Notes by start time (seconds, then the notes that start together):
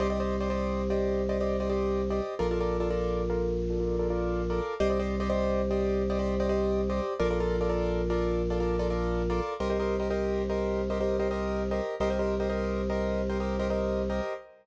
0.00 C2 G4 C5 D5 D#5
0.10 G4 C5 D5 D#5
0.20 G4 C5 D5 D#5
0.41 G4 C5 D5 D#5
0.50 G4 C5 D5 D#5
0.90 G4 C5 D5 D#5
1.29 G4 C5 D5 D#5
1.41 G4 C5 D5 D#5
1.60 G4 C5 D5 D#5
1.70 G4 C5 D5 D#5
2.10 G4 C5 D5 D#5
2.39 A#1 F4 A4 A#4 D5
2.51 F4 A4 A#4 D5
2.60 F4 A4 A#4 D5
2.80 F4 A4 A#4 D5
2.90 F4 A4 A#4 D5
3.30 F4 A4 A#4 D5
3.70 F4 A4 A#4 D5
3.80 F4 A4 A#4 D5
3.99 F4 A4 A#4 D5
4.10 F4 A4 A#4 D5
4.50 F4 A4 A#4 D5
4.80 C2 G4 C5 D5 D#5
4.90 G4 C5 D5 D#5
4.99 G4 C5 D5 D#5
5.20 G4 C5 D5 D#5
5.29 G4 C5 D5 D#5
5.71 G4 C5 D5 D#5
6.10 G4 C5 D5 D#5
6.19 G4 C5 D5 D#5
6.40 G4 C5 D5 D#5
6.49 G4 C5 D5 D#5
6.90 G4 C5 D5 D#5
7.20 A#1 F4 A4 A#4 D5
7.30 F4 A4 A#4 D5
7.40 F4 A4 A#4 D5
7.61 F4 A4 A#4 D5
7.69 F4 A4 A#4 D5
8.10 F4 A4 A#4 D5
8.50 F4 A4 A#4 D5
8.60 F4 A4 A#4 D5
8.79 F4 A4 A#4 D5
8.90 F4 A4 A#4 D5
9.30 F4 A4 A#4 D5
9.60 C2 G4 A#4 C5 D#5
9.70 G4 A#4 C5 D#5
9.80 G4 A#4 C5 D#5
10.00 G4 A#4 C5 D#5
10.10 G4 A#4 C5 D#5
10.50 G4 A#4 C5 D#5
10.90 G4 A#4 C5 D#5
11.01 G4 A#4 C5 D#5
11.19 G4 A#4 C5 D#5
11.31 G4 A#4 C5 D#5
11.71 G4 A#4 C5 D#5
12.00 C2 G4 A#4 C5 D#5
12.10 G4 A#4 C5 D#5
12.19 G4 A#4 C5 D#5
12.40 G4 A#4 C5 D#5
12.50 G4 A#4 C5 D#5
12.90 G4 A#4 C5 D#5
13.30 G4 A#4 C5 D#5
13.40 G4 A#4 C5 D#5
13.59 G4 A#4 C5 D#5
13.70 G4 A#4 C5 D#5
14.10 G4 A#4 C5 D#5